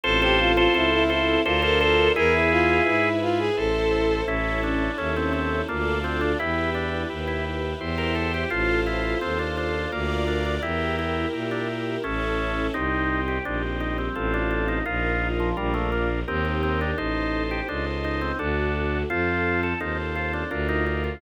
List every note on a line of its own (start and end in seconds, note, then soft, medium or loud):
0.04 0.67 A1 loud
0.04 0.67 C4 medium
0.04 1.44 C4 loud
0.04 0.67 F4 medium
0.04 1.44 F4 medium
0.04 0.20 A4 medium
0.04 0.21 A4 medium
0.04 0.67 A4 medium
0.04 1.44 A4 loud
0.04 0.21 C5 loud
0.21 0.38 G4 medium
0.21 0.52 A4 loud
0.21 0.52 C5 loud
0.39 0.56 F4 medium
0.57 0.74 F4 medium
0.57 0.74 A4 loud
0.57 0.74 C5 loud
0.74 1.37 C#2 medium
0.74 1.38 C4 medium
0.74 0.92 E4 medium
0.74 1.38 F4 medium
0.74 1.04 A4 medium
0.74 1.38 A4 medium
0.74 1.04 C5 loud
0.92 1.09 E4 medium
1.10 1.42 E4 medium
1.10 1.41 A4 medium
1.10 1.41 C5 medium
1.44 2.09 D2 medium
1.44 2.09 D4 medium
1.44 2.16 D4 loud
1.44 1.62 F4 medium
1.44 2.09 F4 medium
1.44 2.16 F4 loud
1.44 1.62 A4 medium
1.44 2.09 A#4 medium
1.44 2.16 A#4 loud
1.44 1.62 C5 loud
1.62 1.79 A4 medium
1.62 1.79 C5 loud
1.80 2.09 A4 medium
1.80 2.12 A4 medium
1.80 2.12 C5 loud
2.16 2.80 E2 medium
2.16 2.79 E4 medium
2.16 3.56 E4 loud
2.16 3.09 E4 medium
2.16 2.79 G#4 medium
2.16 3.56 G#4 medium
2.16 3.09 G#4 loud
2.16 2.33 A#4 medium
2.16 2.79 B4 medium
2.16 3.56 B4 loud
2.33 2.50 E4 medium
2.51 2.83 F4 medium
2.86 3.50 G#2 medium
2.86 3.49 E4 medium
2.86 3.19 E4 medium
2.86 3.49 G#4 medium
2.86 3.49 B4 medium
3.22 3.39 F4 medium
3.39 3.56 G#4 medium
3.57 4.22 A1 medium
3.57 4.27 E4 medium
3.57 4.21 E4 medium
3.57 4.23 A4 medium
3.57 4.27 A4 medium
3.57 4.21 A4 medium
3.57 4.27 C5 loud
3.57 4.21 C5 medium
4.26 4.89 A1 medium
4.26 5.67 C#4 loud
4.26 4.91 C#4 loud
4.26 5.67 E4 medium
4.26 4.91 E4 medium
4.26 4.61 E4 medium
4.26 5.67 A4 medium
4.26 4.91 A4 loud
4.63 4.97 D4 medium
4.98 5.62 D#2 medium
4.98 5.15 C#4 medium
4.98 5.62 C#4 medium
4.98 5.62 E4 medium
4.98 5.62 A4 medium
5.16 5.33 C4 medium
5.33 5.62 C4 medium
5.68 6.35 D2 medium
5.68 5.99 A#3 medium
5.68 6.39 D4 loud
5.68 6.32 D4 medium
5.68 6.39 F4 loud
5.68 6.32 F4 medium
5.68 6.39 A4 loud
5.68 6.32 A4 medium
6.04 6.21 C4 medium
6.21 6.38 D4 medium
6.39 7.05 E2 medium
6.39 7.79 E4 medium
6.39 7.03 E4 medium
6.39 6.70 E4 medium
6.39 7.79 G4 medium
6.39 7.03 G4 medium
6.39 7.79 B4 medium
6.39 7.03 B4 medium
6.75 7.09 D4 medium
7.10 7.74 D#2 medium
7.10 7.73 E4 medium
7.10 7.73 G4 medium
7.10 7.73 B4 medium
7.27 7.44 E4 medium
7.80 8.45 E2 medium
7.80 8.44 E4 medium
7.80 8.51 E4 medium
7.80 8.44 G4 medium
7.80 8.51 G4 loud
7.80 8.44 C5 loud
7.80 8.50 C5 medium
7.98 8.15 A#4 medium
8.15 8.32 A4 medium
8.34 8.51 G4 medium
8.50 9.15 A1 medium
8.50 8.81 F4 medium
8.50 9.90 F4 loud
8.50 9.15 F4 medium
8.50 9.90 A4 medium
8.50 9.15 A4 medium
8.50 9.90 C5 loud
8.50 9.15 C5 medium
8.86 9.19 E4 medium
9.21 9.87 D#2 medium
9.21 9.38 C4 medium
9.21 9.85 F4 medium
9.21 9.85 A4 medium
9.21 9.85 C5 medium
9.39 9.56 D4 medium
9.57 9.91 D4 medium
9.92 10.58 D2 loud
9.92 10.25 A#3 medium
9.92 10.62 F4 medium
9.92 10.56 F4 medium
9.92 10.62 A#4 medium
9.92 10.56 A#4 medium
9.92 10.62 D5 loud
9.92 10.56 D5 medium
10.27 10.44 D4 medium
10.45 10.62 D4 medium
10.62 11.26 E2 medium
10.62 10.96 E4 medium
10.62 12.02 E4 medium
10.62 11.26 E4 medium
10.62 12.02 G4 medium
10.62 11.26 G4 medium
10.62 12.02 A#4 medium
10.62 11.26 A#4 medium
10.99 11.28 E4 medium
11.33 11.97 A#2 medium
11.33 11.97 E4 medium
11.33 11.97 G4 medium
11.33 11.97 A#4 medium
11.51 11.68 D4 medium
12.04 12.69 A1 medium
12.04 12.67 C#4 medium
12.04 12.74 C#4 loud
12.04 12.67 E4 medium
12.04 12.74 E4 loud
12.04 12.67 A4 medium
12.04 12.74 A4 medium
12.74 13.39 C2 medium
12.74 13.38 C4 loud
12.74 13.44 C4 medium
12.74 13.21 D#4 medium
12.74 13.38 D#4 medium
12.74 13.45 D#4 medium
12.74 13.38 G4 medium
12.74 13.44 G4 medium
13.28 13.45 G4 medium
13.45 14.09 A#1 medium
13.45 14.15 G3 medium
13.45 14.15 C4 medium
13.45 14.09 C4 medium
13.45 13.62 D4 medium
13.45 14.09 D#4 medium
13.45 14.15 G4 medium
13.45 14.09 G4 medium
13.80 13.97 D#4 medium
13.98 14.15 C4 medium
14.15 14.81 A1 loud
14.15 14.79 C4 medium
14.15 14.32 C4 medium
14.15 14.86 C4 medium
14.15 14.79 F4 medium
14.15 14.86 F4 medium
14.15 14.79 A4 medium
14.15 14.86 A4 medium
14.34 14.50 D4 medium
14.51 14.67 D4 medium
14.68 14.85 D#4 medium
14.86 15.53 A#1 loud
14.86 15.50 D#4 medium
14.86 15.56 D#4 medium
14.86 15.28 F4 medium
14.86 15.50 F4 medium
14.86 15.56 F4 medium
14.86 15.50 A#4 medium
14.86 15.56 A#4 medium
15.40 15.56 F3 medium
15.57 16.23 A#1 loud
15.57 15.74 G3 medium
15.57 16.20 D4 loud
15.57 16.27 D4 medium
15.57 16.20 F4 medium
15.57 16.27 F4 medium
15.57 16.20 A#4 medium
15.57 16.27 A#4 medium
15.74 15.91 A3 medium
15.92 16.09 A#3 medium
16.27 16.93 D#2 loud
16.27 16.44 C4 medium
16.27 16.97 D#4 medium
16.27 16.91 D#4 medium
16.27 16.97 G4 medium
16.27 16.91 G4 loud
16.27 16.97 A#4 medium
16.27 16.91 A#4 medium
16.45 16.62 C4 medium
16.63 16.80 C4 medium
16.81 16.98 D4 medium
16.98 17.61 A1 medium
16.98 17.61 D#4 loud
16.98 17.43 D#4 medium
16.98 17.68 D#4 medium
16.98 17.61 A4 medium
16.98 17.68 A4 medium
16.98 17.61 C5 medium
16.98 17.68 C5 medium
17.51 17.68 G4 medium
17.68 18.32 C#2 medium
17.68 17.85 D4 medium
17.68 18.38 D#4 medium
17.68 18.32 D#4 medium
17.68 18.32 A4 medium
17.68 18.38 C5 medium
17.68 18.32 C5 medium
17.68 18.38 D#5 medium
18.04 18.21 D#4 medium
18.21 18.38 C4 medium
18.39 19.04 D2 loud
18.39 19.02 D4 medium
18.39 19.09 D4 medium
18.39 18.98 D4 medium
18.39 19.02 F#4 medium
18.39 19.09 F#4 medium
18.39 19.02 A4 loud
18.39 19.09 A4 medium
19.10 19.74 F2 medium
19.10 19.74 C4 loud
19.10 19.80 C4 medium
19.10 19.61 F4 medium
19.10 19.74 F4 medium
19.10 19.80 F4 medium
19.10 19.74 A4 medium
19.10 19.80 A4 medium
19.63 19.80 A4 medium
19.80 20.44 D#2 medium
19.80 20.44 C4 medium
19.80 20.51 C4 medium
19.80 19.97 D#4 medium
19.80 20.44 F4 medium
19.80 20.44 A4 medium
19.80 20.51 A4 medium
19.80 20.51 C5 medium
20.16 20.32 F4 medium
20.33 20.50 D4 medium
20.51 21.16 D2 loud
20.51 21.21 D4 medium
20.51 20.68 D4 medium
20.51 21.14 D4 medium
20.51 21.21 F4 medium
20.51 21.14 F4 medium
20.51 21.21 A#4 medium
20.51 21.14 A#4 medium
20.69 20.85 D#4 medium
20.86 21.03 D#4 medium
21.04 21.21 F4 medium